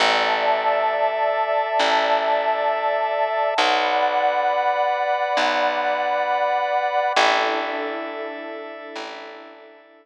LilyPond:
<<
  \new Staff \with { instrumentName = "Pad 2 (warm)" } { \time 6/8 \key a \mixolydian \tempo 4. = 67 <d'' e'' a''>2.~ | <d'' e'' a''>2. | <d'' fis'' b''>2.~ | <d'' fis'' b''>2. |
<d' e' a'>2.~ | <d' e' a'>2. | }
  \new Staff \with { instrumentName = "Drawbar Organ" } { \time 6/8 \key a \mixolydian <a' d'' e''>2.~ | <a' d'' e''>2. | <b' d'' fis''>2.~ | <b' d'' fis''>2. |
<a' d'' e''>2.~ | <a' d'' e''>2. | }
  \new Staff \with { instrumentName = "Electric Bass (finger)" } { \clef bass \time 6/8 \key a \mixolydian a,,2. | a,,2. | b,,2. | b,,2. |
a,,2. | a,,2. | }
>>